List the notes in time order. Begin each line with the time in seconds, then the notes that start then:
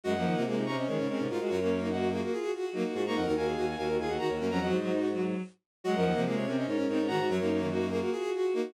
0.04 F#2 G#3 F#4 D#5 F#5
0.14 F#2 F3 A#3
0.24 D#3 A#3
0.33 C3 A#3 F4
0.45 C3 G#3 F4 G#4
0.56 C3 D#4
0.66 C3 C#4 A#5 C#6
0.76 C#4 C5 D#5
0.87 D#3 G#3 C#4 A#4 C#5
0.98 G#2 C#3
1.07 G#3 C4 C#4 A#4 C#5
1.17 G#2 C3
1.28 G#2 D#4 F4 F#4 A#4
1.39 G#3 F#4
1.49 F#2 F4 F#4 A#4 C#5
1.60 F#2 A#3 C#4
1.69 A#3
1.81 A#3 D#4
1.90 F#4 D#5 F#5
2.01 A#3
2.12 A#3 F4 F#4 G#4
2.21 F#4 A#4
2.32 F4 G#4
2.42 F#4
2.52 F4 F#4 G#4
2.63 F#4
2.72 F#3 A#3 D#4 F#4
2.84 F#4
2.94 G#2 F4 F#4 G#4
3.04 G#2 A#3 D#4 A#5 C#6
3.14 F2 A#4 D#5 F#5
3.25 D#2 D#4 F#4 A#4
3.36 D#2 F#4 F5 G#5
3.46 D#2 G#4
3.55 D#2 F#4
3.67 F#4
3.77 D#2 F#4 A#4 F5 G#5
3.87 D#2 F#4
3.97 D#2 F4 G#4 F5 G#5
4.08 D#2 F#4 D#5 F#5
4.17 D#3 F#4 F#5 A#5
4.27 D#2 F#4 A#4 C#5
4.39 F#2 A#3 C#4 F#4 A#4
4.49 F2 F#3 F#5 A#5
4.59 F2 F#3 F#4 D#5 F#5
4.70 G#2 C5 D#5
4.80 F#3
4.90 D#4
5.12 F#3
5.84 F#3 G#3 F#4 D#5 F#5
5.94 F#2 F3 A#4
6.04 D#2 A#3
6.14 C3 F3 A#3
6.24 C3 G#3 F4 G#4
6.36 C3 C#5
6.46 C3 C4 C#4 A#4 C#5
6.56 C#4 C5 D#5
6.67 G#2 C#4 D#4 A#4 C#5
6.77 G#2 C#4
6.87 G#2 C4 D#4 A#4 C#5
6.98 G#2 C#4
7.07 G#2 D#3 F#4 F#5 A#5
7.18 G#2 F#4
7.28 F#2 F#3 F#4 A#4 C#5
7.39 F#2 A#3 D#4
7.49 A#3
7.60 D#3 A#3
7.69 D#4 F#4
7.79 A#3
7.91 A#3 F4 F#4 G#4
8.00 F#4 A#4
8.12 F4 F#4 G#4
8.23 F#4
8.32 F4 F#4 G#4
8.43 F#4
8.53 A#3 D#4 F#4
8.63 F#4